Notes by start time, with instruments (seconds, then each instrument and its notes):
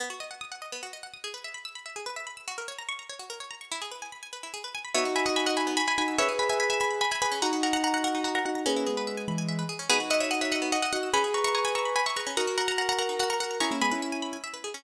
0.00 pizzicato strings B3
0.10 pizzicato strings F#4
0.20 pizzicato strings D#5
0.31 pizzicato strings F#5
0.41 pizzicato strings D#6
0.52 pizzicato strings F#5
0.62 pizzicato strings D#5
0.72 pizzicato strings B3
0.83 pizzicato strings F#4
0.93 pizzicato strings D#5
1.03 pizzicato strings F#5
1.14 pizzicato strings D#6
1.24 pizzicato strings G#4
1.34 pizzicato strings B4
1.44 pizzicato strings E5
1.54 pizzicato strings B5
1.65 pizzicato strings E6
1.75 pizzicato strings B5
1.86 pizzicato strings E5
1.96 pizzicato strings G#4
2.06 pizzicato strings B4
2.16 pizzicato strings E5
2.27 pizzicato strings B5
2.37 pizzicato strings E6
2.48 pizzicato strings F#4
2.58 pizzicato strings A#4
2.68 pizzicato strings C#5
2.79 pizzicato strings A#5
2.89 pizzicato strings C#6
2.99 pizzicato strings A#5
3.09 pizzicato strings C#5
3.19 pizzicato strings F#4
3.30 pizzicato strings A#4
3.40 pizzicato strings C#5
3.51 pizzicato strings A#5
3.61 pizzicato strings C#6
3.71 pizzicato strings E4
3.82 pizzicato strings G#4
3.91 pizzicato strings B4
4.02 pizzicato strings G#5
4.12 pizzicato strings B5
4.23 pizzicato strings G#5
4.33 pizzicato strings B4
4.43 pizzicato strings E4
4.54 pizzicato strings G#4
4.64 pizzicato strings B4
4.75 pizzicato strings G#5
4.85 pizzicato strings B5
4.95 pizzicato strings B3 C#5 E5, acoustic grand piano D#4 F#4
5.05 pizzicato strings F#4
5.16 pizzicato strings E5 G#5 B5
5.26 pizzicato strings D#5 F#5
5.36 pizzicato strings G#5 B5 E6
5.46 pizzicato strings D#5 F#5
5.57 pizzicato strings E5 G#5 B5
5.67 pizzicato strings B3
5.77 pizzicato strings F#4 G#5 B5
5.87 pizzicato strings E5 G#5 B5
5.98 acoustic grand piano D#4 F#4, pizzicato strings F#5 G#5 B5
6.08 pizzicato strings E6
6.18 pizzicato strings C#4 C#5 E5, acoustic grand piano G#4 B4
6.29 pizzicato strings G#4
6.39 pizzicato strings B4 G#5 B5
6.49 pizzicato strings E5 G#5
6.60 pizzicato strings G#5 B5
6.70 pizzicato strings E5 G#5 B5
6.80 pizzicato strings G#5 B5 E6
6.91 pizzicato strings B5
7.01 pizzicato strings G#5 B5
7.11 pizzicato strings E5 G#5 B5
7.22 acoustic grand piano G#4 B4, pizzicato strings B4 G#5 B5
7.32 pizzicato strings C#4
7.42 pizzicato strings D#4 F#5 A#5, acoustic grand piano D#4 F#4
7.53 pizzicato strings F#4
7.63 pizzicato strings A#4 F#5 A#5
7.73 pizzicato strings F#5 A#5
7.84 pizzicato strings F#5 A#5
7.94 pizzicato strings F#5 A#5
8.04 pizzicato strings A#4 F#5 A#5
8.15 pizzicato strings D#4
8.24 pizzicato strings F#4 F#5 A#5
8.35 pizzicato strings A#4 F#5 A#5
8.45 acoustic grand piano D#4 F#4, pizzicato strings F#5 A#5
8.55 pizzicato strings A#5
8.66 acoustic grand piano A#3 C#4, pizzicato strings C#4 G#4 B4
8.76 pizzicato strings E4
8.87 acoustic grand piano G#3 B3, pizzicato strings G#4
8.97 pizzicato strings B4
9.07 pizzicato strings E5
9.17 pizzicato strings G#5
9.28 acoustic grand piano E3 G#3, pizzicato strings B5
9.38 pizzicato strings G#5
9.49 pizzicato strings E5
9.59 pizzicato strings B4
9.69 pizzicato strings G#4
9.79 pizzicato strings C#4
9.90 pizzicato strings B3 G#4 B4, acoustic grand piano D#4 F#4
10.00 pizzicato strings F#4
10.10 pizzicato strings D#5 E5 F#5
10.20 pizzicato strings C#5 E5 F#5
10.31 pizzicato strings D#5 F#5 E6
10.41 pizzicato strings C#5 E5 F#5
10.52 pizzicato strings D#5 E5 F#5
10.62 pizzicato strings B3
10.72 pizzicato strings F#4 D#5 F#5
10.82 pizzicato strings D#5 E5 F#5
10.93 acoustic grand piano D#4 F#4, pizzicato strings D#5 F#5
11.03 pizzicato strings E6
11.13 pizzicato strings C#4 G#5 B5, acoustic grand piano G#4 B4
11.24 pizzicato strings G#4
11.34 pizzicato strings B4 A#5 C#6
11.44 pizzicato strings E5 A#5 C#6
11.55 pizzicato strings G#5 A#5 C#6
11.65 pizzicato strings G#5 B5
11.75 pizzicato strings A#5 C#6 E6
11.85 pizzicato strings B5
11.96 pizzicato strings G#5 B5
12.06 pizzicato strings E5 A#5 C#6
12.16 acoustic grand piano G#4 B4, pizzicato strings B4 A#5 C#6
12.27 pizzicato strings C#4
12.37 pizzicato strings D#4 F#5 A#5, acoustic grand piano F#4 A#4
12.47 pizzicato strings F#4
12.58 pizzicato strings A#4 F#5 A#5
12.68 pizzicato strings F#5 A#5
12.78 pizzicato strings F#5 A#5
12.89 pizzicato strings F#5 A#5
12.99 pizzicato strings A#4 F#5 A#5
13.09 pizzicato strings D#4
13.19 pizzicato strings F#4 F#5 A#5
13.30 pizzicato strings A#4 F#5 A#5
13.40 acoustic grand piano F#4 A#4, pizzicato strings F#5 A#5
13.51 pizzicato strings A#5
13.60 pizzicato strings C#4 A#5 C#6, acoustic grand piano E4 G#4
13.71 acoustic grand piano A#3 C#4, pizzicato strings E4
13.81 acoustic grand piano G#3 B3, pizzicato strings G#4 G#5 B5
13.91 acoustic grand piano C#4 E4, pizzicato strings B4
14.02 pizzicato strings E5
14.12 pizzicato strings G#5
14.22 pizzicato strings B5
14.33 pizzicato strings G#5
14.44 pizzicato strings E5
14.54 pizzicato strings B4
14.64 pizzicato strings G#4
14.74 pizzicato strings C#4